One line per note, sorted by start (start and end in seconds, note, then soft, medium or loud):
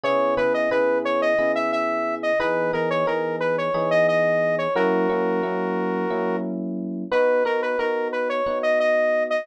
0.04 0.35 C#3 medium
0.04 0.35 B3 medium
0.04 0.35 E4 medium
0.04 0.35 G#4 medium
0.04 0.35 C#5 medium
0.37 0.68 C#3 medium
0.37 0.68 B3 medium
0.37 0.68 E4 medium
0.37 0.68 G#4 medium
0.37 0.53 B4 medium
0.54 0.70 D#5 medium
0.71 1.33 C#3 medium
0.71 1.33 B3 medium
0.71 1.33 E4 medium
0.71 1.33 G#4 medium
0.71 0.99 B4 medium
1.05 1.21 C#5 medium
1.22 1.52 D#5 medium
1.38 2.32 C#3 medium
1.38 2.32 B3 medium
1.38 2.32 E4 medium
1.38 2.32 G#4 medium
1.55 1.71 E5 medium
1.72 2.15 E5 medium
2.23 2.39 D#5 medium
2.40 2.71 E3 medium
2.40 2.71 B3 medium
2.40 2.71 D#4 medium
2.40 2.71 G#4 medium
2.40 2.72 B4 medium
2.73 3.04 E3 medium
2.73 3.04 B3 medium
2.73 3.04 D#4 medium
2.73 3.04 G#4 medium
2.73 2.89 A#4 medium
2.90 3.06 C#5 medium
3.07 3.69 E3 medium
3.07 3.69 B3 medium
3.07 3.69 D#4 medium
3.07 3.69 G#4 medium
3.07 3.36 A#4 medium
3.40 3.56 B4 medium
3.58 3.90 C#5 medium
3.74 4.67 E3 medium
3.74 4.67 B3 medium
3.74 4.67 D#4 medium
3.74 4.67 G#4 medium
3.91 4.07 D#5 medium
4.08 4.56 D#5 medium
4.58 4.74 C#5 medium
4.75 5.06 F#3 medium
4.75 5.06 A#3 medium
4.75 5.06 C#4 medium
4.75 5.06 E4 medium
4.75 6.37 F#4 medium
4.75 6.37 A#4 medium
5.09 5.40 F#3 medium
5.09 5.40 A#3 medium
5.09 5.40 C#4 medium
5.09 5.40 E4 medium
5.43 6.05 F#3 medium
5.43 6.05 A#3 medium
5.43 6.05 C#4 medium
5.43 6.05 E4 medium
6.10 7.04 F#3 medium
6.10 7.04 A#3 medium
6.10 7.04 C#4 medium
6.10 7.04 E4 medium
7.12 7.43 B3 medium
7.12 7.43 D#4 medium
7.12 7.43 F#4 medium
7.12 7.44 B4 medium
7.45 7.76 B3 medium
7.45 7.76 D#4 medium
7.45 7.76 F#4 medium
7.45 7.61 A#4 medium
7.62 7.78 B4 medium
7.79 8.41 B3 medium
7.79 8.41 D#4 medium
7.79 8.41 F#4 medium
7.79 8.08 A#4 medium
8.12 8.29 B4 medium
8.29 8.59 C#5 medium
8.46 9.39 B3 medium
8.46 9.39 D#4 medium
8.46 9.39 F#4 medium
8.63 8.79 D#5 medium
8.80 9.24 D#5 medium
9.30 9.46 D#5 medium